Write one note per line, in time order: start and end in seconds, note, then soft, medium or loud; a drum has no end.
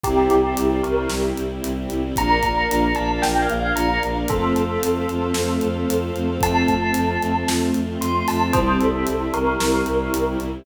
0.04 0.28 C2 medium
0.04 2.15 G3 medium
0.04 0.36 C4 loud
0.04 2.15 C4 medium
0.04 0.36 E4 loud
0.04 2.15 E4 medium
0.04 0.28 G4 medium
0.04 0.36 G4 loud
0.04 kick medium
0.04 closed hi-hat medium
0.30 0.54 C2 medium
0.30 0.76 G4 medium
0.30 closed hi-hat medium
0.44 0.76 C4 medium
0.44 0.76 E4 loud
0.44 0.76 G4 medium
0.57 0.81 C2 medium
0.57 closed hi-hat medium
0.83 1.07 C2 medium
0.83 0.95 C4 medium
0.83 0.95 E4 medium
0.83 0.95 G4 medium
0.83 1.06 A#4 medium
0.83 closed hi-hat medium
0.97 1.08 C4 loud
0.97 1.08 E4 medium
0.97 1.08 G4 medium
1.09 1.33 C2 medium
1.09 1.43 C4 medium
1.09 1.43 E4 medium
1.09 1.43 G4 loud
1.09 snare medium
1.37 1.60 C2 medium
1.37 closed hi-hat medium
1.50 1.71 C4 medium
1.50 1.71 E4 medium
1.50 1.71 G4 medium
1.64 1.86 C2 medium
1.64 closed hi-hat medium
1.77 1.87 C4 medium
1.77 1.87 E4 medium
1.77 1.87 G4 medium
1.90 2.12 C2 medium
1.90 2.01 C4 medium
1.90 2.01 E4 loud
1.90 2.01 G4 medium
1.90 closed hi-hat medium
2.04 2.14 C4 medium
2.04 2.14 E4 medium
2.04 2.14 G4 medium
2.16 2.40 A#1 medium
2.16 2.48 A#3 loud
2.16 2.48 D4 loud
2.16 2.48 F4 loud
2.16 4.27 A#4 medium
2.16 4.27 D5 medium
2.16 4.27 F5 medium
2.16 2.90 A#5 medium
2.16 kick medium
2.16 closed hi-hat medium
2.43 2.66 A#1 medium
2.43 kick medium
2.43 closed hi-hat medium
2.57 2.88 A#3 loud
2.57 2.88 D4 loud
2.57 2.88 F4 loud
2.70 2.93 A#1 medium
2.70 closed hi-hat medium
2.95 3.19 A#1 medium
2.95 3.07 A#3 medium
2.95 3.07 D4 medium
2.95 3.07 F4 medium
2.95 3.19 A5 medium
2.95 closed hi-hat medium
3.10 3.20 A#3 medium
3.10 3.20 D4 loud
3.10 3.20 F4 medium
3.22 3.46 A#1 medium
3.22 3.55 A#3 medium
3.22 3.55 D4 medium
3.22 3.55 F4 medium
3.22 3.39 G5 medium
3.22 snare medium
3.42 3.59 F5 medium
3.49 3.72 A#1 medium
3.49 closed hi-hat medium
3.60 3.84 A#3 medium
3.60 3.84 D4 medium
3.60 3.84 F4 medium
3.60 3.77 F5 medium
3.75 3.98 A#1 medium
3.75 3.99 A#5 medium
3.75 closed hi-hat medium
3.89 4.00 A#3 medium
3.89 4.00 D4 medium
3.89 4.00 F4 medium
4.03 4.25 A#1 medium
4.03 4.13 A#3 medium
4.03 4.13 D4 loud
4.03 4.13 F4 medium
4.03 closed hi-hat medium
4.16 4.26 A#3 medium
4.16 4.26 D4 medium
4.16 4.26 F4 loud
4.28 4.52 F2 medium
4.28 4.61 A3 loud
4.28 4.61 C4 loud
4.28 4.61 F4 loud
4.28 6.40 A4 medium
4.28 6.36 A4 medium
4.28 6.40 C5 medium
4.28 6.40 F5 medium
4.28 kick loud
4.28 closed hi-hat medium
4.55 4.77 F2 medium
4.55 closed hi-hat medium
4.69 5.01 A3 medium
4.69 5.01 C4 loud
4.69 5.01 F4 loud
4.83 5.06 F2 medium
4.83 closed hi-hat loud
5.09 5.32 F2 medium
5.09 5.19 A3 medium
5.09 5.19 C4 medium
5.09 5.19 F4 medium
5.09 closed hi-hat medium
5.22 5.33 A3 medium
5.22 5.33 C4 loud
5.22 5.33 F4 medium
5.34 5.58 F2 medium
5.34 5.67 A3 loud
5.34 5.67 C4 medium
5.34 5.67 F4 medium
5.34 snare loud
5.61 5.85 F2 medium
5.61 closed hi-hat medium
5.75 5.96 A3 medium
5.75 5.96 C4 medium
5.75 5.96 F4 medium
5.88 6.11 F2 medium
5.88 closed hi-hat medium
6.02 6.12 A3 medium
6.02 6.12 C4 medium
6.02 6.12 F4 medium
6.15 6.38 F2 medium
6.15 6.26 A3 loud
6.15 6.26 C4 medium
6.15 6.26 F4 medium
6.15 closed hi-hat medium
6.28 6.39 A3 medium
6.28 6.39 C4 loud
6.28 6.39 F4 medium
6.41 6.63 F2 loud
6.41 6.73 A3 loud
6.41 8.52 A3 medium
6.41 6.73 C4 loud
6.41 8.52 C4 medium
6.41 6.73 F4 loud
6.41 8.52 F4 medium
6.41 7.46 A5 medium
6.41 kick medium
6.41 closed hi-hat loud
6.68 6.91 F2 medium
6.68 kick medium
6.68 closed hi-hat medium
6.81 7.13 A3 medium
6.81 7.13 C4 loud
6.81 7.13 F4 medium
6.94 7.17 F2 medium
6.94 closed hi-hat medium
7.21 7.44 F2 medium
7.21 7.32 A3 loud
7.21 7.32 C4 medium
7.21 7.32 F4 medium
7.21 closed hi-hat medium
7.35 7.45 A3 medium
7.35 7.45 C4 medium
7.35 7.45 F4 medium
7.48 7.71 F2 medium
7.48 7.80 A3 medium
7.48 7.80 C4 medium
7.48 7.80 F4 medium
7.48 snare loud
7.74 7.96 F2 medium
7.74 closed hi-hat medium
7.88 8.09 A3 medium
7.88 8.09 C4 loud
7.88 8.09 F4 medium
8.00 8.23 F2 medium
8.00 8.23 C6 medium
8.00 closed hi-hat medium
8.14 8.25 A3 medium
8.14 8.25 C4 medium
8.14 8.25 F4 medium
8.27 8.51 F2 medium
8.27 8.38 A3 medium
8.27 8.38 C4 medium
8.27 8.38 F4 medium
8.27 8.53 A5 medium
8.27 open hi-hat medium
8.41 8.51 A3 loud
8.41 8.51 C4 medium
8.41 8.51 F4 medium
8.53 8.76 C2 loud
8.53 10.64 G3 medium
8.53 8.86 G3 loud
8.53 10.64 C4 medium
8.53 8.86 C4 loud
8.53 10.64 E4 medium
8.53 8.86 E4 loud
8.53 8.75 C5 medium
8.53 kick loud
8.53 closed hi-hat medium
8.80 9.04 C2 medium
8.80 9.27 A4 medium
8.80 closed hi-hat medium
8.94 9.26 G3 medium
8.94 9.26 C4 medium
8.94 9.26 E4 medium
9.07 9.29 C2 medium
9.07 closed hi-hat medium
9.34 9.56 C2 medium
9.34 9.44 G3 loud
9.34 9.44 C4 medium
9.34 9.44 E4 medium
9.34 10.27 A#4 medium
9.34 closed hi-hat medium
9.47 9.57 G3 medium
9.47 9.57 C4 medium
9.47 9.57 E4 medium
9.60 9.82 C2 medium
9.60 9.92 G3 medium
9.60 9.92 C4 medium
9.60 9.92 E4 medium
9.60 snare loud
9.86 10.09 C2 medium
9.86 closed hi-hat medium
10.00 10.21 G3 medium
10.00 10.21 C4 medium
10.00 10.21 E4 medium
10.13 10.36 C2 medium
10.13 closed hi-hat medium
10.27 10.37 G3 medium
10.27 10.37 C4 medium
10.27 10.37 E4 medium
10.40 10.62 C2 medium
10.40 10.50 G3 medium
10.40 10.50 C4 medium
10.40 10.50 E4 loud
10.40 closed hi-hat medium
10.53 10.64 G3 medium
10.53 10.64 C4 medium
10.53 10.64 E4 medium